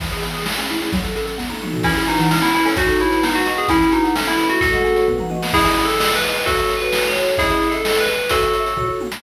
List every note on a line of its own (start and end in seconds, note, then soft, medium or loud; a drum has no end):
0.00 0.10 E3 medium
0.00 0.44 E3 loud
0.00 kick loud
0.00 crash medium
0.11 0.34 G#4 medium
0.11 0.22 G#4 medium
0.11 closed hi-hat medium
0.22 0.45 B3 medium
0.22 0.33 G#4 medium
0.22 closed hi-hat medium
0.34 0.44 G#4 medium
0.34 0.45 G#4 medium
0.34 closed hi-hat medium
0.46 0.90 A3 medium
0.46 0.56 A3 medium
0.46 snare loud
0.58 0.68 C#4 medium
0.58 0.91 G#4 medium
0.58 closed hi-hat medium
0.69 0.91 C#4 medium
0.69 0.80 E4 medium
0.69 closed hi-hat medium
0.81 0.92 E4 medium
0.81 0.91 G#4 medium
0.81 closed hi-hat medium
0.92 1.36 F#3 medium
0.92 1.03 F#3 medium
0.92 kick loud
0.92 closed hi-hat medium
1.03 1.26 A4 medium
1.03 1.14 A4 medium
1.03 closed hi-hat medium
1.15 1.37 C#4 medium
1.15 1.26 A4 medium
1.15 closed hi-hat medium
1.26 1.36 A4 medium
1.26 1.37 A4 medium
1.26 closed hi-hat medium
1.38 1.48 B3 medium
1.38 1.82 B3 medium
1.38 kick medium
1.38 snare medium
1.49 1.60 D#4 medium
1.49 1.83 A4 medium
1.49 high tom medium
1.61 1.84 D#4 medium
1.61 1.72 F#4 medium
1.61 mid tom medium
1.73 1.84 F#4 medium
1.73 1.85 A4 medium
1.73 floor tom loud
1.83 1.94 E3 medium
1.83 2.04 C#4 medium
1.83 2.28 E4 medium
1.83 2.04 E4 medium
1.83 kick loud
1.83 crash loud
1.96 2.07 G#4 medium
1.96 2.29 G#5 medium
1.96 closed hi-hat medium
2.07 2.30 D#4 medium
2.07 2.18 F#4 medium
2.07 2.30 B4 medium
2.07 closed hi-hat medium
2.19 2.41 E3 medium
2.19 2.30 F#5 medium
2.19 closed hi-hat medium
2.31 2.41 C#4 medium
2.31 2.75 E4 medium
2.31 snare loud
2.42 2.52 B3 medium
2.42 2.52 E4 medium
2.42 2.75 A5 medium
2.42 closed hi-hat medium
2.54 2.65 C#4 medium
2.54 2.65 E4 medium
2.54 2.76 B4 medium
2.54 closed hi-hat medium
2.65 2.75 C#4 medium
2.65 2.76 A4 medium
2.65 2.76 C#5 medium
2.65 open hi-hat medium
2.76 2.86 F#3 medium
2.76 2.97 D#4 medium
2.76 3.21 F#4 loud
2.76 2.97 F#4 medium
2.76 kick loud
2.76 closed hi-hat loud
2.88 2.98 A4 medium
2.88 3.22 A5 medium
2.88 closed hi-hat medium
2.99 3.22 E4 medium
2.99 3.10 G#4 medium
2.99 3.21 C#5 medium
2.99 closed hi-hat medium
3.11 3.22 A4 medium
3.11 3.66 B4 loud
3.11 closed hi-hat medium
3.23 3.33 B3 medium
3.23 3.35 D#4 medium
3.23 snare loud
3.35 3.46 D#4 medium
3.35 3.46 F#4 medium
3.35 3.57 F#5 medium
3.35 closed hi-hat medium
3.45 3.55 F#4 medium
3.45 3.57 F#4 medium
3.45 3.69 D#5 medium
3.45 closed hi-hat medium
3.57 3.69 B3 medium
3.57 3.68 G#4 medium
3.57 3.69 F#5 medium
3.57 closed hi-hat medium
3.68 3.81 E3 medium
3.68 3.90 C#4 medium
3.68 4.13 E4 loud
3.68 3.90 E4 medium
3.68 kick loud
3.68 closed hi-hat loud
3.80 3.91 G#4 medium
3.80 4.14 G#5 medium
3.80 closed hi-hat medium
3.92 4.12 D#4 medium
3.92 4.03 F#4 medium
3.92 4.15 B4 medium
3.92 closed hi-hat medium
4.03 4.13 G#4 medium
4.03 4.15 F#5 medium
4.03 closed hi-hat medium
4.15 4.26 A3 medium
4.15 4.26 C#4 medium
4.15 4.59 A4 loud
4.15 snare loud
4.26 4.37 B3 medium
4.26 4.37 E4 medium
4.26 4.60 E5 medium
4.26 closed hi-hat medium
4.37 4.49 C#4 medium
4.37 4.47 E4 medium
4.37 4.60 B4 medium
4.37 closed hi-hat medium
4.49 5.05 A3 loud
4.49 4.61 E4 medium
4.49 4.59 F#4 medium
4.49 closed hi-hat medium
4.61 4.72 A2 medium
4.61 5.06 F#4 medium
4.61 5.06 A4 medium
4.61 kick loud
4.61 closed hi-hat medium
4.73 4.83 G#3 medium
4.73 5.06 F#5 medium
4.73 closed hi-hat medium
4.84 4.95 C#4 medium
4.84 5.07 G#4 medium
4.84 closed hi-hat medium
4.96 5.07 F#4 medium
4.96 5.07 C#5 medium
4.96 closed hi-hat medium
5.08 5.18 B3 medium
5.08 5.52 B4 loud
5.08 kick medium
5.08 floor tom medium
5.18 5.30 D#4 medium
5.18 5.42 F#5 medium
5.18 mid tom medium
5.30 5.40 F#4 medium
5.30 5.53 D#5 medium
5.30 high tom medium
5.42 5.53 B3 medium
5.42 5.53 F#5 medium
5.42 snare loud
5.53 5.63 C#4 medium
5.53 5.84 E4 medium
5.53 5.84 G#4 medium
5.53 5.63 D#5 medium
5.53 5.63 E5 medium
5.53 5.63 G#5 medium
5.53 kick loud
5.53 crash loud
5.65 5.83 C#4 medium
5.65 5.83 D#5 medium
5.65 5.83 E5 medium
5.65 5.83 G#5 medium
5.65 closed hi-hat medium
5.78 closed hi-hat medium
5.85 6.10 A4 medium
5.89 closed hi-hat medium
6.00 6.18 G#4 medium
6.00 6.18 C5 medium
6.00 6.18 D#5 medium
6.00 snare loud
6.13 6.42 B4 medium
6.13 closed hi-hat medium
6.23 6.28 G#4 medium
6.23 6.28 C5 medium
6.23 6.28 D#5 medium
6.23 closed hi-hat medium
6.29 6.38 G#4 medium
6.29 6.38 C5 medium
6.29 6.38 D#5 medium
6.34 open hi-hat medium
6.40 6.45 G#4 medium
6.40 6.45 C5 medium
6.40 6.45 D#5 medium
6.46 6.73 F#4 medium
6.46 6.73 A4 medium
6.46 6.56 A4 medium
6.46 6.56 C#5 medium
6.46 6.56 E5 medium
6.46 kick loud
6.46 closed hi-hat loud
6.57 6.76 A4 medium
6.57 6.76 C#5 medium
6.57 6.76 E5 medium
6.57 closed hi-hat medium
6.69 closed hi-hat medium
6.77 7.04 B4 medium
6.77 closed hi-hat medium
6.81 7.11 F#4 medium
6.81 7.11 A4 medium
6.81 7.11 C#5 medium
6.92 snare loud
7.04 7.35 C#5 medium
7.04 closed hi-hat medium
7.15 7.20 F#4 medium
7.15 7.20 A4 medium
7.15 7.20 C#5 medium
7.15 closed hi-hat medium
7.21 7.31 F#4 medium
7.21 7.31 A4 medium
7.21 7.31 C#5 medium
7.27 closed hi-hat medium
7.32 7.37 F#4 medium
7.32 7.37 A4 medium
7.32 7.37 C#5 medium
7.38 7.48 C#4 medium
7.38 7.68 E4 medium
7.38 7.48 G#4 medium
7.38 7.68 G#4 medium
7.38 7.48 D#5 medium
7.38 7.48 E5 medium
7.38 kick loud
7.38 closed hi-hat loud
7.49 7.64 C#4 medium
7.49 7.64 G#4 medium
7.49 7.64 D#5 medium
7.49 7.64 E5 medium
7.49 closed hi-hat medium
7.62 closed hi-hat medium
7.67 7.72 C#4 medium
7.67 7.72 G#4 medium
7.67 7.98 A4 medium
7.67 7.72 D#5 medium
7.67 7.72 E5 medium
7.72 7.82 C#4 medium
7.72 7.82 G#4 medium
7.72 7.82 D#5 medium
7.72 7.82 E5 medium
7.72 closed hi-hat medium
7.85 7.94 G#4 medium
7.85 7.94 C5 medium
7.85 7.94 D#5 medium
7.85 snare loud
7.96 8.15 G#4 medium
7.96 8.28 B4 medium
7.96 8.15 C5 medium
7.96 8.15 D#5 medium
7.96 closed hi-hat medium
8.08 closed hi-hat medium
8.19 closed hi-hat medium
8.29 8.89 F#4 medium
8.29 8.89 A4 medium
8.29 8.40 A4 loud
8.29 8.40 C#5 medium
8.29 8.40 E5 medium
8.29 kick loud
8.29 closed hi-hat loud
8.42 8.56 A4 medium
8.42 8.56 C#5 medium
8.42 8.56 E5 medium
8.42 closed hi-hat medium
8.53 closed hi-hat medium
8.60 8.64 A4 medium
8.60 8.64 C#5 medium
8.60 8.64 E5 medium
8.65 8.74 A4 medium
8.65 8.74 C#5 medium
8.65 8.74 E5 medium
8.65 closed hi-hat medium
8.77 8.86 F#4 medium
8.77 8.86 A4 medium
8.77 8.86 C#5 loud
8.77 kick medium
8.77 floor tom medium
8.88 9.07 F#4 medium
8.88 9.07 A4 medium
8.88 9.07 C#5 medium
9.00 high tom medium
9.12 snare loud